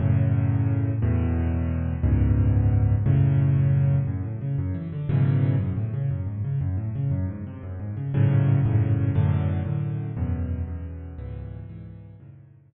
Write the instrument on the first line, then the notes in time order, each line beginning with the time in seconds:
acoustic grand piano
0.00 F#2 A2 C#3
1.02 E2 A2 B2
2.03 C#2 F#2 G#2 B2
3.06 F#2 A2 C#3
4.07 F#2
4.23 A2
4.41 C#3
4.58 F#2
4.74 E3
4.92 D3
5.09 F#2 G#2 B2 C#3 E3
5.59 F#2
5.76 A2
5.94 C#3
6.11 F#2
6.27 G#2
6.44 C#3
6.61 F#2
6.77 A2
6.95 C#3
7.11 F#2
7.28 G#2
7.47 C3
7.63 F#2
7.80 G#2
7.97 C#3
8.14 F#2 G#2 A2 C#3
8.65 F#2 G#2 A2 C#3
9.15 F#2 A2 D3
9.65 F#2 A2 D3
10.17 E2 F#2 B2
10.68 E2 F#2 B2
11.18 C#2 G#2 B2 E3
11.69 C#2 G#2 B2 E3
12.20 F#2 G#2 A2 C#3